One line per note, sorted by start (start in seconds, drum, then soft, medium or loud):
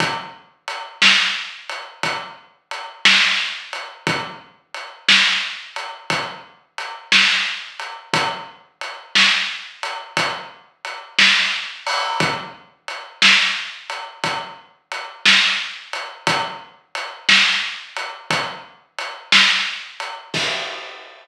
0.00 kick loud
0.00 closed hi-hat loud
0.68 closed hi-hat medium
1.02 snare loud
1.69 closed hi-hat medium
2.03 kick medium
2.03 closed hi-hat loud
2.71 closed hi-hat medium
3.05 snare loud
3.73 closed hi-hat medium
4.07 kick loud
4.07 closed hi-hat loud
4.74 closed hi-hat medium
5.08 snare loud
5.76 closed hi-hat medium
6.10 kick loud
6.10 closed hi-hat loud
6.78 closed hi-hat medium
7.12 snare loud
7.80 closed hi-hat medium
8.14 kick loud
8.14 closed hi-hat loud
8.81 closed hi-hat medium
9.15 snare loud
9.83 closed hi-hat medium
10.17 kick loud
10.17 closed hi-hat loud
10.85 closed hi-hat medium
11.19 snare loud
11.87 open hi-hat medium
12.20 kick loud
12.20 closed hi-hat loud
12.88 closed hi-hat medium
13.22 snare loud
13.90 closed hi-hat medium
14.24 kick loud
14.24 closed hi-hat loud
14.92 closed hi-hat medium
15.26 snare loud
15.93 closed hi-hat medium
16.27 kick loud
16.27 closed hi-hat loud
16.95 closed hi-hat medium
17.29 snare loud
17.96 closed hi-hat medium
18.31 kick loud
18.31 closed hi-hat loud
18.99 closed hi-hat medium
19.32 snare loud
20.00 closed hi-hat medium
20.34 kick loud
20.34 crash loud